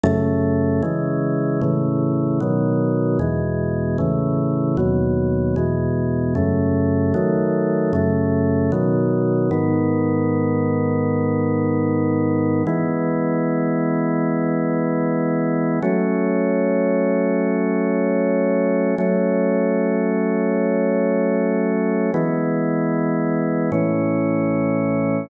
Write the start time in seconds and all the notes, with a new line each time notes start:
0.03 F#2 C#3 A3
0.82 C#3 E3 G#3
1.61 A2 C#3 E3
2.40 B2 D#3 F#3
3.19 E2 B2 G#3
3.98 A2 C#3 E3
4.77 D#2 B2 F#3
5.56 E2 B2 G#3
6.35 F#2 C#3 A3
7.14 D#3 F#3 A3
7.93 F#2 C#3 A3
8.72 B2 D#3 F#3
9.51 G#2 D#3 B3
12.67 E3 G#3 B3
15.82 F#3 A3 C#4
18.98 F#3 A3 C#4
22.14 E3 G#3 B3
23.72 A2 E3 C#4